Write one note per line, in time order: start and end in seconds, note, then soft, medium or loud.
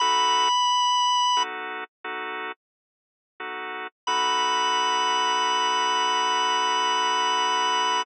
0.00 0.48 B3 medium
0.00 0.48 D#4 medium
0.00 0.48 F#4 medium
0.00 0.48 A4 loud
0.00 1.43 B5 loud
1.37 1.84 B3 medium
1.37 1.84 D#4 medium
1.37 1.84 F#4 medium
1.37 1.84 A4 medium
2.04 2.52 B3 medium
2.04 2.52 D#4 medium
2.04 2.52 F#4 medium
2.04 2.52 A4 medium
3.40 3.87 B3 medium
3.40 3.87 D#4 medium
3.40 3.87 F#4 medium
3.40 3.87 A4 medium
4.07 8.03 B3 loud
4.07 8.03 D#4 medium
4.07 8.03 F#4 loud
4.07 8.03 A4 loud
4.07 8.02 B5 loud